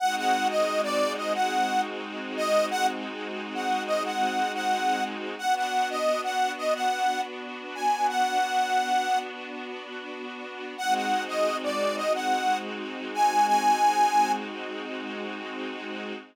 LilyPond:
<<
  \new Staff \with { instrumentName = "Harmonica" } { \time 4/4 \key aes \major \tempo 4 = 89 ges''16 ges''8 ees''8 d''8 ees''16 ges''8. r8. ees''8 | ges''16 r4 ges''8 ees''16 ges''8. ges''8. r8 | fis''16 fis''8 ees''8 fis''8 ees''16 fis''8. r8. aes''8 | fis''2 r2 |
ges''16 ges''8 ees''8 d''8 ees''16 ges''8. r8. aes''8 | aes''4. r2 r8 | }
  \new Staff \with { instrumentName = "String Ensemble 1" } { \time 4/4 \key aes \major <aes c' ees' ges'>1~ | <aes c' ees' ges'>1 | <b d' fis'>1~ | <b d' fis'>1 |
<aes c' ees' ges'>1~ | <aes c' ees' ges'>1 | }
>>